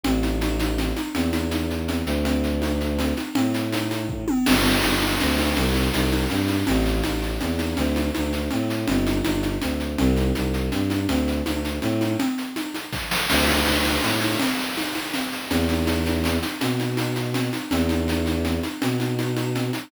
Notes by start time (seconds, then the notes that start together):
0.04 A1, low conga, shaker
0.23 high conga, shaker
0.41 high conga, shaker
0.60 high conga, shaker
0.78 low conga, shaker
0.96 high conga, shaker
1.14 E2, low conga, shaker
1.33 high conga, shaker
1.51 high conga, shaker
1.70 shaker
1.88 low conga, shaker
2.06 D2, shaker
2.25 low conga, shaker
2.44 shaker
2.62 high conga, shaker
2.80 shaker
2.99 low conga, shaker
3.17 high conga, shaker
3.35 A2, low conga, shaker
3.54 shaker
3.72 high conga, shaker
3.91 high conga, shaker
4.09 kick
4.28 high tom
4.46 G1, crash, low conga, shaker
4.65 shaker
4.82 G1, high conga, shaker
5.01 high conga, shaker
5.20 D2, low conga, shaker
5.38 high conga, shaker
5.56 C2, low conga, shaker
5.74 high conga, shaker
5.92 C2, high conga, shaker
6.11 high conga, shaker
6.29 G2, low conga, shaker
6.48 high conga, shaker
6.67 A1, low conga, shaker
6.85 shaker
7.03 A1, high conga, shaker
7.22 shaker
7.40 E2, low conga, shaker
7.59 high conga, shaker
7.77 D2, low conga, shaker
7.96 high conga, shaker
8.15 D2, high conga, shaker
8.33 shaker
8.51 A2, low conga, shaker
8.70 shaker
8.87 G1, low conga, shaker
9.06 high conga, shaker
9.24 G1, high conga, shaker
9.43 high conga, shaker
9.62 D2, low conga, shaker
9.80 shaker
9.98 C2, low conga, shaker
10.16 high conga, shaker
10.35 C2, high conga, shaker
10.54 shaker
10.72 G2, low conga, shaker
10.90 high conga, shaker
11.08 D2, low conga, shaker
11.27 shaker
11.46 D2, high conga, shaker
11.65 shaker
11.82 A2, low conga, shaker
12.01 high conga, shaker
12.19 low conga, shaker
12.38 shaker
12.56 high conga, shaker
12.74 high conga, shaker
12.93 kick, snare
13.11 snare
13.29 D2, crash, low conga, shaker
13.48 high conga, shaker
13.65 D2, high conga, shaker
13.85 high conga, shaker
14.03 A2, low conga, shaker
14.21 high conga, shaker
14.40 low conga, shaker
14.59 shaker
14.77 high conga, shaker
14.95 high conga, shaker
15.13 low conga, shaker
15.32 shaker
15.50 E2, low conga, shaker
15.69 high conga, shaker
15.87 high conga, shaker
16.06 high conga, shaker
16.24 low conga, shaker
16.42 high conga, shaker
16.61 B2, low conga, shaker
16.79 high conga, shaker
16.97 high conga, shaker
17.16 high conga, shaker
17.34 low conga, shaker
17.53 high conga, shaker
17.71 E2, low conga, shaker
17.89 high conga, shaker
18.08 high conga, shaker
18.26 high conga, shaker
18.45 low conga, shaker
18.63 high conga, shaker
18.82 B2, low conga, shaker
19.00 high conga, shaker
19.19 high conga, shaker
19.37 high conga, shaker
19.55 low conga, shaker
19.73 high conga, shaker